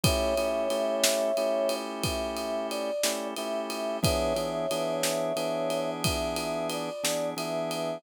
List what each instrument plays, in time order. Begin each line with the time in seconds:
0.04 drawbar organ A3 C#4 E4 G4, brass section C#5 E5, kick, ride
0.38 drawbar organ A3 C#4 E4 G4, ride
0.70 drawbar organ A3 C#4 E4 G4, ride
1.04 snare
1.37 drawbar organ A3 C#4 E4 G4, ride
1.69 ride
2.04 brass section E5, kick, ride
2.37 ride
2.70 brass section D5, ride
3.03 drawbar organ A3 C#4 E4 G4, snare
3.36 drawbar organ A3 C#4 E4 G4, brass section E5, ride
3.70 ride
4.02 drawbar organ E3 B3 D4 G#4, brass section C#5 E5, kick, ride
4.36 drawbar organ E3 B3 D4 G#4, ride
4.71 drawbar organ E3 B3 D4 G#4, ride
5.03 snare
5.36 drawbar organ E3 B3 D4 G#4, ride
5.70 ride
6.03 brass section E5, kick, ride
6.36 ride
6.70 brass section D5, ride
7.04 drawbar organ E3 B3 D4 G#4, snare
7.37 drawbar organ E3 B3 D4 G#4, brass section E5, ride
7.71 ride